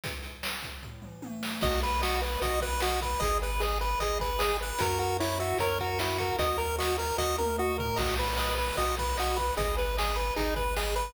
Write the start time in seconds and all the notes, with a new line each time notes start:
0.04 kick, closed hi-hat
0.23 closed hi-hat
0.43 snare
0.62 kick, closed hi-hat
0.83 kick, floor tom
1.02 mid tom
1.22 high tom
1.43 snare
1.61 B1 F#4 D#5, kick, crash
1.82 B4, closed hi-hat
2.01 F#4 D#5, snare
2.21 B4, closed hi-hat
2.41 B1 F#4 D#5, kick, closed hi-hat
2.61 B4, kick, closed hi-hat
2.80 F#4 D#5, snare
3.01 B4, kick, closed hi-hat
3.20 G#1 G#4 D#5, kick, closed hi-hat
3.42 B4, closed hi-hat
3.60 G#4 D#5, snare
3.81 B4, closed hi-hat
4.00 G#1 G#4 D#5, kick, closed hi-hat
4.20 B4, kick, closed hi-hat
4.39 G#4 D#5, snare
4.61 B4, closed hi-hat
4.79 F#2 F#4 A#4, kick, closed hi-hat
4.99 F#4 A#4, closed hi-hat
5.20 E4 C#5, snare
5.39 F#4 E5, closed hi-hat
5.58 F#2 A#4 C#5, kick, closed hi-hat
5.79 F#4 A#4, kick, closed hi-hat
5.99 E4 F#4, snare
6.18 F#4 A#4, kick, closed hi-hat
6.39 D#2 F#4 D#5, kick, closed hi-hat
6.58 A#4, closed hi-hat
6.78 F#4 D#5, snare
6.98 A#4, closed hi-hat
7.18 D#2 F#4 D#5, kick, snare
7.38 A#4, high tom
7.58 F#4 D#5
7.78 A#4, floor tom
7.96 B1 F#4 D#5, kick, crash
8.18 B4, closed hi-hat
8.37 B4 D#5, snare
8.57 B4, closed hi-hat
8.76 B1 F#4 D#5, kick, closed hi-hat
8.97 B4, kick, closed hi-hat
9.17 F#4 D#5, snare
9.37 B4, kick, closed hi-hat
9.57 G#1 G#4 D#5, kick, closed hi-hat
9.77 B4, closed hi-hat
9.97 G#4 D#5, snare
10.16 B4, closed hi-hat
10.36 G#1 D#4 G#4, kick, closed hi-hat
10.56 B4, kick, closed hi-hat
10.76 G#4 D#5, snare
10.96 B4, closed hi-hat